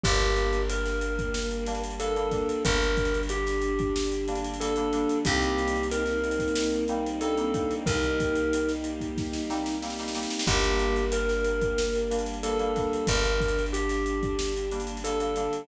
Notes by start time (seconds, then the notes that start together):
0.04 G1 G3 A#3 D4 G4 A#4, kick, crash
0.21 closed hi-hat
0.36 closed hi-hat
0.53 closed hi-hat
0.70 A#4, closed hi-hat
0.86 snare, closed hi-hat
1.01 closed hi-hat
1.19 kick, closed hi-hat
1.34 snare
1.51 closed hi-hat
1.66 G3 A#3 D4, snare, closed hi-hat
1.75 closed hi-hat
1.84 closed hi-hat
1.90 closed hi-hat
2.00 G3 A#3 D4 A4 A#4, closed hi-hat
2.16 G3 A#3 D4, closed hi-hat
2.31 G3 A#3 D4, kick, snare, closed hi-hat
2.49 closed hi-hat
2.65 G1 D3 G3 D4 A#4, kick, closed hi-hat
2.83 closed hi-hat
2.97 kick, closed hi-hat
3.05 closed hi-hat
3.14 closed hi-hat
3.23 closed hi-hat
3.29 G4, closed hi-hat
3.47 snare, closed hi-hat
3.62 closed hi-hat
3.79 kick, closed hi-hat
3.96 snare
4.12 closed hi-hat
4.28 G3 A#3 D4, closed hi-hat
4.35 closed hi-hat
4.45 closed hi-hat
4.54 closed hi-hat
4.59 G3 A#3 D4 A4, closed hi-hat
4.76 G3 A#3 D4, closed hi-hat
4.93 G3 A#3 D4, closed hi-hat
5.09 closed hi-hat
5.25 C2 G3 A#3 C4 D#4 G4, kick, closed hi-hat
5.42 closed hi-hat
5.58 closed hi-hat
5.68 closed hi-hat
5.76 closed hi-hat
5.83 closed hi-hat
5.91 A#4, closed hi-hat
6.06 snare, closed hi-hat
6.24 closed hi-hat
6.31 closed hi-hat
6.39 kick, closed hi-hat
6.48 closed hi-hat
6.55 snare
6.73 closed hi-hat
6.88 G3 A#3 C4 D#4, closed hi-hat
7.07 closed hi-hat
7.21 G3 A#3 C4 D4 D#4 A4, closed hi-hat
7.38 G3 A#3 C4 D#4, closed hi-hat
7.54 G3 A#3 C4 D#4, kick, closed hi-hat
7.71 closed hi-hat
7.86 C2 G3 A#3 D#4 G4 A#4, kick, closed hi-hat
8.03 closed hi-hat
8.20 kick, closed hi-hat
8.36 closed hi-hat
8.53 closed hi-hat
8.69 snare, closed hi-hat
8.84 closed hi-hat
9.00 kick, closed hi-hat
9.18 kick, snare
9.33 snare
9.50 G3 A#3 C4 D#4, snare
9.66 snare
9.82 G3 A#3 C4 D#4, snare
9.90 snare
9.99 G3 A#3 C4 D#4, snare
10.08 snare
10.15 G3 A#3 C4 D#4, snare
10.23 snare
10.30 snare
10.39 snare
10.46 G1 G3 A#3 D4 G4 A#4, kick, crash
10.64 closed hi-hat
10.79 closed hi-hat
10.96 closed hi-hat
11.12 A#4, closed hi-hat
11.29 snare, closed hi-hat
11.45 closed hi-hat
11.61 kick, closed hi-hat
11.78 snare
11.95 closed hi-hat
12.10 G3 A#3 D4, snare, closed hi-hat
12.19 closed hi-hat
12.26 closed hi-hat
12.34 closed hi-hat
12.43 G3 A#3 D4 A4 A#4, closed hi-hat
12.59 G3 A#3 D4, closed hi-hat
12.76 G3 A#3 D4, kick, snare, closed hi-hat
12.93 closed hi-hat
13.07 G1 D3 G3 D4 A#4, kick, closed hi-hat
13.24 closed hi-hat
13.40 kick, closed hi-hat
13.48 closed hi-hat
13.59 closed hi-hat
13.66 closed hi-hat
13.73 G4, closed hi-hat
13.89 snare, closed hi-hat
14.06 closed hi-hat
14.23 kick, closed hi-hat
14.39 snare
14.57 closed hi-hat
14.71 G3 A#3 D4, closed hi-hat
14.80 closed hi-hat
14.87 closed hi-hat
14.97 closed hi-hat
15.04 G3 A#3 D4 A4, closed hi-hat
15.20 G3 A#3 D4, closed hi-hat
15.36 G3 A#3 D4, closed hi-hat
15.53 closed hi-hat